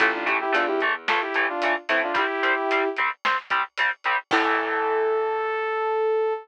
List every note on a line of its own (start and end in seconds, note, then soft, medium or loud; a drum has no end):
0.00 0.46 A1 medium
0.00 0.11 E3 loud
0.00 0.11 A3 loud
0.00 0.13 F4 medium
0.00 0.13 A4 medium
0.00 kick medium
0.00 closed hi-hat medium
0.13 0.26 D4 medium
0.13 0.26 F4 medium
0.26 0.37 E3 medium
0.26 0.37 A3 medium
0.26 0.39 E4 medium
0.26 0.39 G4 medium
0.26 closed hi-hat medium
0.41 0.53 E4 medium
0.41 0.53 G4 loud
0.52 1.69 E2 medium
0.52 0.63 E3 medium
0.52 0.63 A3 medium
0.52 0.67 D4 medium
0.52 0.67 F4 medium
0.52 closed hi-hat loud
0.67 0.80 E4 medium
0.67 0.80 G4 medium
0.80 0.93 E3 medium
0.80 0.93 A3 loud
0.80 closed hi-hat medium
1.08 1.19 E3 medium
1.08 1.19 A3 loud
1.08 1.21 F4 medium
1.08 1.21 A4 medium
1.08 snare medium
1.21 1.47 E4 medium
1.21 1.47 G4 medium
1.34 1.46 E3 medium
1.34 1.46 A3 medium
1.34 closed hi-hat medium
1.49 1.73 D4 medium
1.49 1.73 F4 medium
1.62 1.74 E3 medium
1.62 1.74 A3 medium
1.62 closed hi-hat loud
1.89 2.12 A2 medium
1.89 2.00 E3 medium
1.89 2.00 A3 loud
1.89 2.02 C4 medium
1.89 2.02 E4 medium
1.89 closed hi-hat medium
2.03 2.16 D4 medium
2.03 2.16 F4 medium
2.14 2.25 G3 loud
2.14 2.25 C4 loud
2.14 2.89 E4 medium
2.14 2.89 G4 loud
2.14 kick medium
2.14 closed hi-hat medium
2.43 2.54 G3 medium
2.43 2.54 C4 medium
2.43 closed hi-hat medium
2.71 2.82 G3 medium
2.71 2.82 C4 medium
2.71 closed hi-hat medium
2.97 3.09 G3 medium
2.97 3.09 C4 medium
2.97 closed hi-hat medium
3.25 3.36 G3 medium
3.25 3.36 C4 loud
3.25 snare medium
3.50 3.62 G3 medium
3.50 3.62 C4 medium
3.50 kick medium
3.50 closed hi-hat medium
3.78 3.90 G3 medium
3.78 3.90 C4 medium
3.78 closed hi-hat medium
4.04 4.16 G3 medium
4.04 4.16 C4 medium
4.04 closed hi-hat medium
4.31 6.34 A2 loud
4.31 6.35 E3 loud
4.31 6.35 A3 medium
4.31 6.33 A4 loud
4.31 kick loud
4.31 crash loud